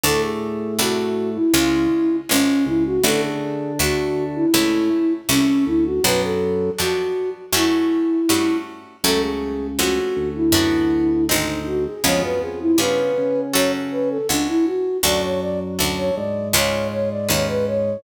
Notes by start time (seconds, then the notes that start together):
0.03 D2 A2 A3 D4 F#4 A4
0.23 G#4
0.79 C2 A3 D4 F#4
1.35 E4
1.54 C#2 C#3 G#3 C#4 F4
2.29 G#1 G#3 C#4 F4
2.66 C#2 C#3 E4
2.85 F#4
3.03 A1 D3 A3 D4 F#4 A4
3.23 G#4
3.79 D2 A3 D4 F#4
4.35 E4
4.54 C#2 A2 A3 C#4 E4
5.29 C2 A3 C#4 E4
5.66 D2 D3 E4
5.85 F#4
6.04 B1 F#2 F#3 B3 D4 F#4 B4
6.23 A4
6.78 F2 B3 D4 F#4
7.53 F#2 A3 C#4 E4 F#4
8.29 G2 A3 C#4 F#4
9.04 C#2 F#2 C#3 A3 C#4 F#4 A4
9.22 G#4
9.79 F2 A3 C#4 F#4
10.16 D2 D3
10.36 E4
10.52 F#2 B3 D4 F#4
11.28 G#1 C4 D#4 G#4
11.66 F#4
11.86 G#4
12.04 C#2 F2 F3 B3 C#4 F4 G#4 C#5
12.22 F#2 F#3 B4
12.41 F2 F3 G#4
12.61 E4
12.78 G2 C#3 B3 C#4 F4 G#4 B4
13.18 C#3 C#4
13.53 F#2 C#4 F#4 A4 C#5
13.91 B4
14.10 A4
14.29 C#2 C#4 D4 F#4 A4
14.48 E4
14.66 F#4
15.03 D2 F#2 F#3 D4 F#4 A4 D5
15.23 C#5
15.41 D5
15.79 D2 D4 F#4 A4
15.98 C#5
16.16 G#2 G#3 D5
16.53 C#2 C#4 F4 G#4 B4 C#5
16.91 C#5
17.11 D5
17.29 D#2 C#4 F4 G#4 B4 C#5
17.48 B4
17.67 C#5